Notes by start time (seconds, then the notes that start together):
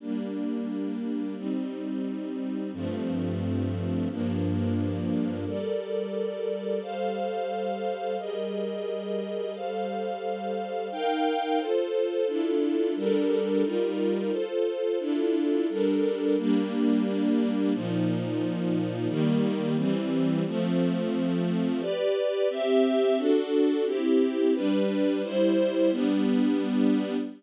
0.00 G3 A#3 D4
1.36 G3 C4 D#4
2.73 G2 F3 A3 C4
4.10 G2 F3 A#3 D4
5.45 G3 A4 A#4 D5
6.82 G3 A4 C5 F5
8.18 G3 G#4 A#4 D#5
9.54 G3 A4 C5 F5
10.92 D#4 A#4 F5 G5
11.59 F4 A4 C5
12.27 D4 E4 F4 A4
12.96 G3 D4 A4 A#4
13.64 G3 D#4 F4 A#4
14.31 F4 A4 C5
14.99 D4 E4 F4 A4
15.69 G3 D4 A4 A#4
16.38 G3 A#3 D4
17.73 A#2 F3 D#4
19.08 D#3 G3 A#3
19.76 E3 G3 C4
20.46 F3 A3 C4
21.81 G4 B4 D5
22.50 C4 G4 E5
23.17 D4 F#4 A4
23.86 C4 E4 G4
24.54 G3 D4 B4
25.23 G3 E4 C5
25.91 G3 B3 D4